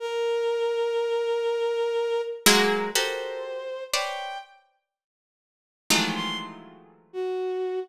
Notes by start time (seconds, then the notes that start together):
0.00 A#4
2.46 F#3 G#3 A#3
2.95 F#4 G4 A4 A#4 C5
3.93 B4 C5 C#5 D5 G5
5.90 D#3 E3 F3 F#3 G#3 A3
6.15 C6
7.13 F#4